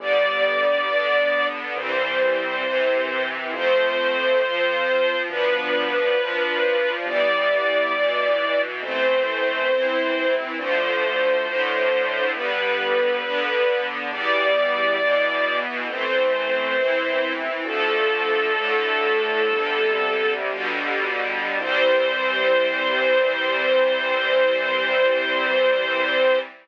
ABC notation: X:1
M:4/4
L:1/8
Q:1/4=68
K:C
V:1 name="String Ensemble 1"
d4 c4 | c4 B4 | d4 c4 | c4 B4 |
d4 c4 | "^rit." A6 z2 | c8 |]
V:2 name="String Ensemble 1"
[D,G,B,]2 [D,B,D]2 [E,G,C]2 [C,E,C]2 | [F,A,C]2 [F,CF]2 [F,B,D]2 [F,DF]2 | [E,G,B,]2 [B,,E,B,]2 [E,A,C]2 [E,CE]2 | [D,F,A,]2 [A,,D,A,]2 [D,G,B,]2 [D,B,D]2 |
[E,G,B,]2 [B,,E,B,]2 [E,A,C]2 [E,CE]2 | "^rit." [D,F,A,]2 [A,,D,A,]2 [C,D,G,]2 [B,,D,G,]2 | [E,G,C]8 |]
V:3 name="Synth Bass 1" clef=bass
G,,,4 C,,4 | F,,4 D,,4 | G,,,4 A,,,4 | D,,4 G,,,4 |
E,,4 A,,,4 | "^rit." D,,4 G,,,2 G,,,2 | C,,8 |]